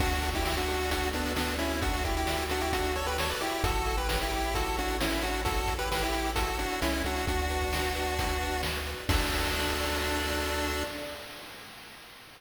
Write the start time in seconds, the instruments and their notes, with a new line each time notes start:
0.00 synth bass 1 D2, lead 1 (square) D4 F#4, kick, crash
0.12 closed hi-hat
0.22 lead 1 (square) A4, kick, closed hi-hat
0.34 lead 1 (square) E4 G4, kick, closed hi-hat
0.45 lead 1 (square) E4 G4 D5, snare
0.57 lead 1 (square) D4 F#4, closed hi-hat
0.68 lead 1 (square) A4, closed hi-hat
0.79 closed hi-hat
0.91 lead 1 (square) D4 F#4, kick, closed hi-hat
1.03 closed hi-hat
1.13 lead 1 (square) B3 D4 A4, closed hi-hat
1.26 closed hi-hat
1.36 lead 1 (square) B3 D4 D5, snare
1.48 closed hi-hat
1.58 lead 1 (square) C#4 E4 A4, closed hi-hat
1.70 closed hi-hat
1.82 lead 1 (square) D4 F#4, kick, closed hi-hat
1.94 closed hi-hat
2.04 lead 1 (square) E4 G4 A4, kick, closed hi-hat
2.16 lead 1 (square) E4 G4, closed hi-hat
2.27 lead 1 (square) D5, snare
2.39 closed hi-hat
2.49 lead 1 (square) D4 F#4 A4, closed hi-hat
2.61 lead 1 (square) E4 G4, closed hi-hat
2.72 lead 1 (square) D4 F#4, kick, closed hi-hat
2.84 closed hi-hat
2.95 lead 1 (square) A4 C#5, closed hi-hat
3.06 lead 1 (square) G4 B4, closed hi-hat
3.18 lead 1 (square) A4 C#5 D5, snare
3.30 lead 1 (square) B4 D5, closed hi-hat
3.41 lead 1 (square) E4 G4 A4, closed hi-hat
3.52 closed hi-hat
3.64 synth bass 1 A1, lead 1 (square) E4 F#4 A4, kick, closed hi-hat
3.76 closed hi-hat
3.86 lead 1 (square) A4, kick, closed hi-hat
3.97 lead 1 (square) G4 B4, closed hi-hat
4.08 lead 1 (square) G4 B4 C#5, kick, snare
4.21 lead 1 (square) E4 G4, closed hi-hat
4.31 lead 1 (square) A4, closed hi-hat
4.43 closed hi-hat
4.54 lead 1 (square) E4 F#4 A4, kick, closed hi-hat
4.65 closed hi-hat
4.77 lead 1 (square) D4 F#4 A4, closed hi-hat
4.88 closed hi-hat
5.00 lead 1 (square) C#4 E4 C#5, snare
5.11 closed hi-hat
5.22 lead 1 (square) D4 F#4 A4, closed hi-hat
5.34 closed hi-hat
5.45 lead 1 (square) E4 F#4 A4, kick, closed hi-hat
5.57 closed hi-hat
5.67 lead 1 (square) A4, kick, closed hi-hat
5.79 lead 1 (square) G4 B4, closed hi-hat
5.91 lead 1 (square) G4 B4 C#5, snare
6.02 lead 1 (square) E4 G4, closed hi-hat
6.13 lead 1 (square) A4, closed hi-hat
6.25 closed hi-hat
6.35 lead 1 (square) E4 F#4 A4, kick, closed hi-hat
6.48 closed hi-hat
6.59 lead 1 (square) D4 F#4 A4, closed hi-hat
6.70 closed hi-hat
6.82 synth bass 1 C2, lead 1 (square) C#4 E4 C#5, snare
6.94 closed hi-hat
7.04 synth bass 1 C#2, lead 1 (square) D4 F#4 A4, closed hi-hat
7.16 closed hi-hat
7.27 synth bass 1 D2, lead 1 (square) D4 F#4, kick, closed hi-hat
7.39 closed hi-hat
7.50 lead 1 (square) B4, closed hi-hat
7.61 kick, closed hi-hat
7.73 lead 1 (square) D5, snare
7.84 closed hi-hat
7.95 lead 1 (square) B4, closed hi-hat
8.07 closed hi-hat
8.18 lead 1 (square) F#4, kick, closed hi-hat
8.29 closed hi-hat
8.41 lead 1 (square) B4, closed hi-hat
8.52 closed hi-hat
8.63 lead 1 (square) D5, snare
8.75 closed hi-hat
8.86 lead 1 (square) B4, closed hi-hat
8.98 closed hi-hat
9.09 synth bass 1 D2, lead 1 (square) D4 F#4 A4 D5, kick, crash